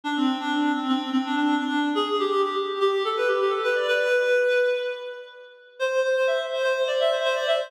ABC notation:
X:1
M:4/4
L:1/16
Q:1/4=125
K:Ador
V:1 name="Clarinet"
D C2 D3 C C2 C D D2 D3 | ^G2 =G G G z G G G A B G G A B d | B8 z8 | c2 c c e z c c c d e c c d e c |]